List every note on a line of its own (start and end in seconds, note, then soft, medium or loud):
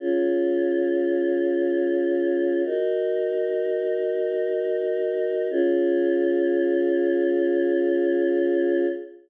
0.00 2.62 C#4 medium
0.00 2.62 F4 medium
0.00 2.62 G#4 medium
2.65 5.47 D#4 medium
2.65 5.47 F#4 medium
2.65 5.47 A#4 medium
5.51 8.86 C#4 medium
5.51 8.86 F4 loud
5.51 8.86 G#4 loud